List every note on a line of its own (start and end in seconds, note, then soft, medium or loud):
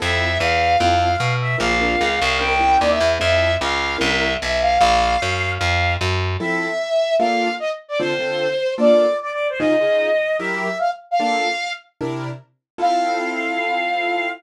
0.00 0.38 F2 medium
0.00 0.28 C4 medium
0.00 0.28 E4 medium
0.00 0.28 F4 medium
0.00 0.28 A4 medium
0.00 0.38 E5 loud
0.40 0.76 E2 medium
0.40 0.78 F5 medium
0.79 1.16 F2 medium
0.79 1.09 C4 loud
0.79 1.09 E4 medium
0.79 1.09 F4 medium
0.79 1.09 A4 medium
0.79 1.17 F5 medium
1.17 1.56 B2 medium
1.17 1.33 F5 medium
1.40 1.57 E5 medium
1.58 1.96 A#1 medium
1.58 1.72 C4 medium
1.58 1.72 D4 medium
1.58 1.72 F4 medium
1.58 1.72 A#4 medium
1.58 2.38 F5 loud
1.81 2.09 C4 medium
1.81 2.09 D4 medium
1.81 2.09 F4 medium
1.81 2.09 A#4 medium
2.01 2.20 C#2 medium
2.22 2.78 C2 medium
2.39 2.54 C4 medium
2.39 2.54 C#4 medium
2.39 2.54 E4 medium
2.39 2.54 A#4 medium
2.39 2.77 G5 medium
2.59 2.87 C4 medium
2.59 2.87 C#4 medium
2.59 2.87 E4 medium
2.59 2.87 A#4 medium
2.80 2.99 D#2 medium
2.80 2.89 D5 medium
2.90 3.07 E5 medium
3.00 3.18 E2 medium
3.19 3.57 F2 medium
3.19 3.48 C4 medium
3.19 3.48 E4 medium
3.19 3.48 F4 medium
3.19 3.48 A4 medium
3.19 3.54 E5 loud
3.61 3.97 C#2 medium
3.61 3.96 F5 medium
3.98 4.37 C2 medium
3.98 4.26 C4 medium
3.98 4.26 C#4 medium
3.98 4.26 E4 loud
3.98 4.26 A#4 medium
3.98 4.33 E5 medium
4.42 4.78 B1 medium
4.42 4.59 E5 medium
4.62 4.78 F5 medium
4.78 5.17 A#1 medium
4.78 5.50 F5 loud
5.22 5.58 F#2 medium
5.58 5.97 F2 medium
5.58 5.93 F5 medium
6.01 6.37 F#2 medium
6.40 6.68 F3 medium
6.40 6.68 C4 loud
6.40 6.68 E4 medium
6.40 6.68 A4 loud
6.40 7.14 E5 loud
7.18 7.48 A#3 loud
7.18 7.48 D4 medium
7.18 7.48 F4 loud
7.18 7.48 A4 medium
7.18 7.54 F5 medium
7.60 7.69 D#5 medium
7.88 7.98 D5 medium
7.99 8.14 D3 loud
7.99 8.14 C4 loud
7.99 8.14 F4 medium
7.99 8.14 A4 loud
7.99 8.73 C5 loud
8.19 8.47 D3 medium
8.19 8.47 C4 medium
8.19 8.47 F4 medium
8.19 8.47 A4 medium
8.78 9.06 A#3 medium
8.78 9.06 D4 medium
8.78 9.06 F4 medium
8.78 9.06 A4 medium
8.78 9.17 D5 medium
9.22 9.30 D5 medium
9.31 9.47 D5 medium
9.50 9.59 C5 medium
9.59 9.74 C#3 medium
9.59 9.74 D#4 loud
9.59 9.74 F4 loud
9.59 9.74 G#4 loud
9.59 10.36 D#5 loud
9.81 10.09 C#3 medium
9.81 10.09 D#4 medium
9.81 10.09 F4 medium
9.81 10.09 G#4 medium
10.39 10.68 F#3 medium
10.39 10.68 E4 medium
10.39 10.68 G4 loud
10.39 10.68 A#4 loud
10.39 10.78 E5 medium
10.79 10.89 F5 medium
11.11 11.19 F5 loud
11.20 11.48 A#3 loud
11.20 11.48 D4 medium
11.20 11.48 F4 medium
11.20 11.48 A4 loud
11.20 11.71 F5 loud
12.01 12.29 C3 loud
12.01 12.29 D4 loud
12.01 12.29 E4 medium
12.01 12.29 A#4 medium
12.78 14.27 C4 loud
12.78 14.27 E4 medium
12.78 14.27 F4 medium
12.78 14.27 A4 loud
12.78 14.29 F5 loud